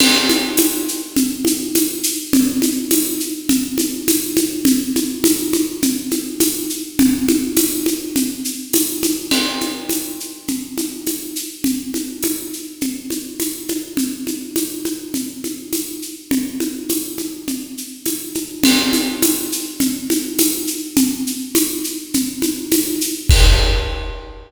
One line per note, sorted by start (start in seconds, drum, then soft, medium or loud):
0.00 crash loud
0.00 low conga medium
0.00 shaker medium
0.29 high conga medium
0.29 shaker medium
0.57 tambourine medium
0.57 high conga medium
0.57 shaker medium
0.88 shaker medium
1.17 low conga medium
1.17 shaker medium
1.45 high conga medium
1.45 shaker medium
1.75 tambourine medium
1.75 high conga medium
1.75 shaker medium
2.03 shaker medium
2.33 low conga loud
2.33 shaker medium
2.62 high conga medium
2.62 shaker medium
2.91 tambourine medium
2.91 high conga medium
2.91 shaker medium
3.20 shaker medium
3.49 low conga medium
3.49 shaker medium
3.78 high conga medium
3.78 shaker medium
4.08 tambourine medium
4.08 high conga medium
4.08 shaker medium
4.37 high conga medium
4.37 shaker medium
4.65 low conga medium
4.65 shaker medium
4.96 high conga medium
4.96 shaker medium
5.24 tambourine medium
5.24 high conga medium
5.24 shaker medium
5.53 high conga medium
5.53 shaker medium
5.82 low conga medium
5.82 shaker medium
6.11 high conga medium
6.11 shaker medium
6.40 tambourine medium
6.40 high conga medium
6.40 shaker medium
6.70 shaker medium
6.99 low conga loud
6.99 shaker medium
7.28 high conga medium
7.28 shaker medium
7.57 tambourine medium
7.57 high conga medium
7.57 shaker medium
7.86 high conga medium
7.86 shaker medium
8.16 low conga medium
8.16 shaker medium
8.45 shaker medium
8.73 tambourine medium
8.73 high conga medium
8.73 shaker medium
9.03 high conga medium
9.03 shaker medium
9.31 crash medium
9.31 low conga medium
9.31 shaker medium
9.61 high conga medium
9.61 shaker medium
9.89 tambourine medium
9.89 high conga medium
9.89 shaker medium
10.20 shaker soft
10.48 low conga medium
10.48 shaker medium
10.78 high conga medium
10.78 shaker medium
11.07 tambourine medium
11.07 high conga medium
11.07 shaker medium
11.36 shaker medium
11.64 low conga medium
11.64 shaker medium
11.94 high conga medium
11.94 shaker medium
12.23 tambourine medium
12.23 high conga medium
12.23 shaker medium
12.53 shaker soft
12.81 low conga medium
12.81 shaker medium
13.10 high conga medium
13.10 shaker medium
13.40 tambourine medium
13.40 high conga medium
13.40 shaker medium
13.68 high conga medium
13.68 shaker medium
13.97 low conga medium
13.97 shaker medium
14.27 high conga medium
14.27 shaker medium
14.56 tambourine medium
14.56 high conga medium
14.56 shaker medium
14.85 high conga medium
14.85 shaker soft
15.14 low conga medium
15.14 shaker medium
15.44 high conga soft
15.44 shaker soft
15.73 tambourine medium
15.73 high conga medium
15.73 shaker medium
16.02 shaker soft
16.31 low conga medium
16.31 shaker medium
16.60 high conga medium
16.60 shaker soft
16.89 tambourine medium
16.89 high conga medium
16.89 shaker medium
17.18 high conga medium
17.18 shaker soft
17.48 low conga medium
17.48 shaker medium
17.77 shaker medium
18.06 tambourine medium
18.06 high conga medium
18.06 shaker medium
18.35 high conga medium
18.35 shaker medium
18.63 crash medium
18.63 low conga loud
18.63 shaker medium
18.93 high conga medium
18.93 shaker medium
19.22 tambourine medium
19.22 high conga medium
19.22 shaker medium
19.52 shaker medium
19.80 low conga medium
19.80 shaker medium
20.10 high conga medium
20.10 shaker medium
20.39 tambourine medium
20.39 high conga medium
20.39 shaker medium
20.67 shaker medium
20.97 low conga medium
20.97 shaker medium
21.27 shaker medium
21.55 tambourine medium
21.55 high conga medium
21.55 shaker medium
21.84 shaker medium
22.14 low conga medium
22.14 shaker medium
22.42 high conga medium
22.42 shaker medium
22.72 tambourine medium
22.72 high conga medium
22.72 shaker medium
23.01 shaker medium
23.29 kick loud
23.29 crash loud